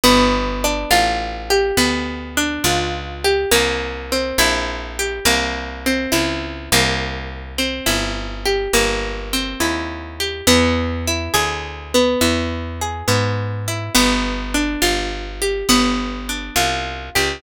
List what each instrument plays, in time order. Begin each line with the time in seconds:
0.03 electric bass (finger) G1, acoustic guitar (steel) B3
0.64 acoustic guitar (steel) D4
0.91 electric bass (finger) A1, acoustic guitar (steel) F4
1.50 acoustic guitar (steel) G4
1.77 electric bass (finger) D2, acoustic guitar (steel) B3
2.37 acoustic guitar (steel) D4
2.64 electric bass (finger) C#2, acoustic guitar (steel) F4
3.24 acoustic guitar (steel) G4
3.51 electric bass (finger) C2, acoustic guitar (steel) A#3
4.12 acoustic guitar (steel) C4
4.38 electric bass (finger) A#1, acoustic guitar (steel) E4
4.99 acoustic guitar (steel) G4
5.25 electric bass (finger) C2, acoustic guitar (steel) A#3
5.86 acoustic guitar (steel) C4
6.12 electric bass (finger) C#2, acoustic guitar (steel) E4
6.72 electric bass (finger) C2, acoustic guitar (steel) A#3
7.58 acoustic guitar (steel) C4
7.86 electric bass (finger) G1, acoustic guitar (steel) E4
8.45 acoustic guitar (steel) G4
8.73 electric bass (finger) G1, acoustic guitar (steel) A#3
9.33 acoustic guitar (steel) C4
9.60 electric bass (finger) D#2, acoustic guitar (steel) E4
10.20 acoustic guitar (steel) G4
10.47 electric bass (finger) E2, acoustic guitar (steel) B3
11.07 acoustic guitar (steel) E4
11.34 electric bass (finger) D2, acoustic guitar (steel) G#4
11.94 acoustic guitar (steel) B3
12.21 electric bass (finger) E2, acoustic guitar (steel) E4
12.81 acoustic guitar (steel) G#4
13.08 electric bass (finger) G#2, acoustic guitar (steel) B3
13.68 acoustic guitar (steel) E4
13.95 electric bass (finger) G1, acoustic guitar (steel) B3
14.54 acoustic guitar (steel) D4
14.82 electric bass (finger) G1, acoustic guitar (steel) F4
15.42 acoustic guitar (steel) G4
15.69 electric bass (finger) G1, acoustic guitar (steel) B3
16.29 acoustic guitar (steel) D4
16.56 electric bass (finger) C2, acoustic guitar (steel) F4
17.15 electric bass (finger) C#2, acoustic guitar (steel) G4